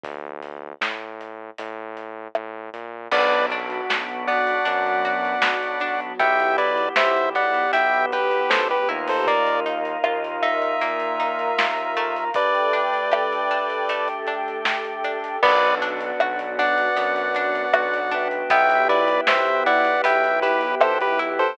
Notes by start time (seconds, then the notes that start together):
0.04 D2, kick, closed hi-hat
0.42 closed hi-hat
0.81 A2, snare
1.21 closed hi-hat
1.58 A2, closed hi-hat
1.97 closed hi-hat
2.35 A2, cross-stick
2.73 A#2, closed hi-hat
3.11 B1 B3 D4 F#4 B4 D5, kick, crash
3.32 closed hi-hat
3.50 D4, closed hi-hat
3.70 closed hi-hat
3.89 B1 F#4, snare
4.08 closed hi-hat
4.27 B3 D5 F#5, closed hi-hat
4.47 closed hi-hat
4.65 F#2 F#3 B3 D4 F#4, closed hi-hat
4.86 closed hi-hat
5.05 F#4, closed hi-hat
5.25 closed hi-hat
5.42 B1 B3, snare
5.63 closed hi-hat
5.80 D4, closed hi-hat
6.01 closed hi-hat
6.19 B1 B3 E4 G4 E5 G5, kick, closed hi-hat
6.40 closed hi-hat
6.58 E4 B4 D5, closed hi-hat
6.77 closed hi-hat
6.96 B1 G4 C5 E5, snare
7.17 closed hi-hat
7.35 B3 D5 F#5, closed hi-hat
7.54 closed hi-hat
7.73 B1 B3 E4 G4 B4 E5 G5, closed hi-hat
7.93 closed hi-hat
8.12 G4 B4, closed hi-hat
8.31 closed hi-hat
8.50 C#2 B3 A4 C5, snare
8.70 G4 B4, closed hi-hat
8.89 D#2 A#3 D#4 E4 F4, closed hi-hat
9.08 A4 C5, open hi-hat
9.27 A#3 A#4 D5 D#5 F5, kick, closed hi-hat
9.47 closed hi-hat
9.66 D#4, closed hi-hat
9.85 closed hi-hat
10.04 D#2 F4, cross-stick
10.24 closed hi-hat
10.42 D#4 E5, closed hi-hat
10.62 closed hi-hat
10.81 A#2 A#3 A#4 F5 A#5, closed hi-hat
11.00 closed hi-hat
11.20 D#4, closed hi-hat
11.39 closed hi-hat
11.58 D#2 F4, snare
11.77 closed hi-hat
11.97 A3, closed hi-hat
12.16 closed hi-hat
12.34 A3 D4 G4 A4 B4 D5 G5, kick, closed hi-hat
12.55 closed hi-hat
12.73 D4, closed hi-hat
12.94 closed hi-hat
13.12 G4, cross-stick
13.33 closed hi-hat
13.51 D4, closed hi-hat
13.70 closed hi-hat
13.89 A3 G4 A4 G5, closed hi-hat
14.08 closed hi-hat
14.27 D4, closed hi-hat
14.48 closed hi-hat
14.65 G4, snare
14.85 closed hi-hat
15.04 D4, closed hi-hat
15.24 closed hi-hat
15.43 B1 B3 D4 F#4 B4 D5 F#5, kick, crash
15.63 closed hi-hat
15.82 D4, closed hi-hat
16.00 closed hi-hat
16.20 B1 F#4, cross-stick
16.39 closed hi-hat
16.59 D4 D5 F#5, closed hi-hat
16.78 closed hi-hat
16.96 F#2 B3, closed hi-hat
17.16 closed hi-hat
17.35 D4, closed hi-hat
17.55 closed hi-hat
17.73 B1 F#4, cross-stick
17.94 closed hi-hat
18.11 D4 B4 E5 G5, closed hi-hat
18.31 closed hi-hat
18.50 B1 B3 E4 G4 E5 G5, kick, closed hi-hat
18.70 closed hi-hat
18.89 E4 B4 D5, closed hi-hat
19.08 closed hi-hat
19.27 B1 G4 C5 E5, snare
19.46 closed hi-hat
19.66 E4 D5 F#5, closed hi-hat
19.85 closed hi-hat
20.04 B1 B3 E5 G5, closed hi-hat
20.24 closed hi-hat
20.42 E4 G4 B4, closed hi-hat
20.61 closed hi-hat
20.80 B1 G4 A4 C5, cross-stick
21.01 G4 B4, closed hi-hat
21.19 E4, closed hi-hat
21.39 A4 C5, closed hi-hat